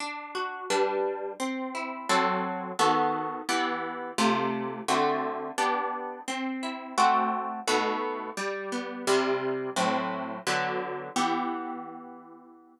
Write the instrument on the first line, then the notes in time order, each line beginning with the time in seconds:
acoustic guitar (steel)
0.00 D4
0.35 F#4
0.70 G3 D4 B4
1.40 C4
1.75 E4
2.09 F#3 C4 A4
2.79 D#3 B3 F#4 A4
3.49 E3 B3 G4
4.18 C3 A3 F4
4.88 D3 A3 C4 F#4
5.58 B3 D4 G4
6.28 C4
6.63 E4
6.98 A3 C4 F#4
7.67 B2 A3 D#4 F#4
8.37 G3
8.72 B3
9.07 C3 G3 E4
9.76 A2 F#3 C4
10.47 D3 F#3 B3
11.16 E3 B3 G4